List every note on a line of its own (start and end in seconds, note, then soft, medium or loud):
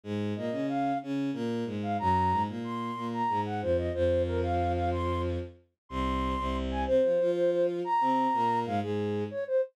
0.03 0.33 G#2 medium
0.03 0.33 G#3 loud
0.36 0.50 A#2 medium
0.36 0.50 A#3 medium
0.36 0.67 D#5 medium
0.52 0.92 C#3 medium
0.52 0.92 C#4 medium
0.69 0.98 F5 medium
1.03 1.30 C#3 medium
1.03 1.30 C#4 loud
1.33 1.64 A#2 medium
1.33 1.64 A#3 loud
1.66 1.96 G#2 medium
1.66 1.96 G#3 medium
1.83 1.97 F5 medium
1.99 2.32 F#2 medium
1.99 2.32 F#3 loud
1.99 2.42 A#5 loud
2.31 2.47 G#2 medium
2.31 2.47 G#3 medium
2.48 2.90 A#2 medium
2.48 2.90 A#3 medium
2.64 3.07 C6 medium
2.95 3.22 A#2 medium
2.95 3.22 A#3 medium
3.13 3.41 A#5 medium
3.29 3.61 G#2 medium
3.29 3.61 G#3 medium
3.45 3.61 F#5 medium
3.61 3.89 F2 medium
3.61 3.89 F3 medium
3.61 3.76 C5 medium
3.78 3.93 D#5 medium
3.94 5.37 F2 medium
3.94 5.37 F3 loud
3.94 4.22 C5 loud
4.26 4.40 A#4 loud
4.43 4.72 F5 medium
4.75 4.90 F5 medium
4.92 5.21 C6 medium
5.89 6.35 C2 medium
5.89 6.35 C3 loud
5.89 6.56 C6 loud
6.38 6.85 C2 medium
6.38 6.85 C3 loud
6.70 6.84 G#5 medium
6.87 7.00 C3 medium
6.87 7.00 C4 loud
6.87 7.31 C5 loud
7.03 7.18 F3 medium
7.03 7.18 F4 medium
7.20 7.81 F3 medium
7.20 7.81 F4 loud
7.35 7.50 C5 loud
7.52 7.66 C5 loud
7.84 8.59 A#5 loud
8.01 8.27 C3 medium
8.01 8.27 C4 medium
8.33 8.65 A#2 medium
8.33 8.65 A#3 loud
8.66 8.80 G#2 medium
8.66 8.80 G#3 loud
8.66 8.79 F5 medium
8.82 9.23 G#2 medium
8.82 9.23 G#3 medium
8.82 9.24 G#4 loud
9.31 9.44 C#5 medium
9.47 9.61 C5 medium